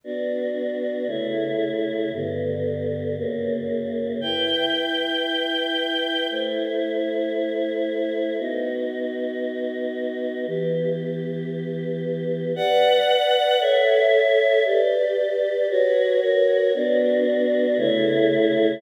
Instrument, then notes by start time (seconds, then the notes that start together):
choir aahs
0.04 B3 D4 F#4
1.07 C#3 A3 E4
2.12 G2 D3 B3
3.17 F#2 C#3 A#3
4.21 E4 B4 G5
6.30 A3 E4 C5
8.38 B3 D#4 F#4
10.46 E3 B3 G4
12.56 B4 D5 F#5
13.60 A4 C#5 E5
14.65 G4 B4 D5
15.69 F#4 B4 C#5
16.20 F#4 A#4 C#5
16.74 B3 D4 F#4
17.78 C#3 A3 E4